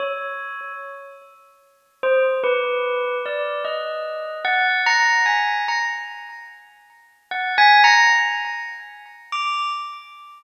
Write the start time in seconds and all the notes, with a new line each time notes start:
0.00 C#5
2.03 C5
2.44 B4
3.26 D5
3.65 D#5
4.45 F#5
4.86 A#5
5.26 G#5
5.68 A#5
7.31 F#5
7.58 G#5
7.84 A#5
9.32 D6